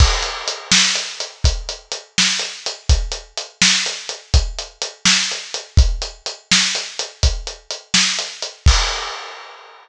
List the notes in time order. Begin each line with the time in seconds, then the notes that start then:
0.00 kick, crash
0.22 closed hi-hat
0.48 closed hi-hat
0.72 snare
0.95 closed hi-hat
1.20 closed hi-hat
1.44 kick, closed hi-hat
1.69 closed hi-hat
1.92 closed hi-hat
2.18 snare
2.39 closed hi-hat
2.66 closed hi-hat
2.89 kick, closed hi-hat
3.12 closed hi-hat
3.37 closed hi-hat
3.62 snare
3.86 closed hi-hat
4.09 closed hi-hat
4.34 kick, closed hi-hat
4.59 closed hi-hat
4.82 closed hi-hat
5.05 snare
5.32 closed hi-hat
5.54 closed hi-hat
5.77 kick, closed hi-hat
6.02 closed hi-hat
6.26 closed hi-hat
6.52 snare
6.75 closed hi-hat
6.99 closed hi-hat
7.23 kick, closed hi-hat
7.47 closed hi-hat
7.71 closed hi-hat
7.94 snare
8.19 closed hi-hat
8.42 closed hi-hat
8.66 kick, crash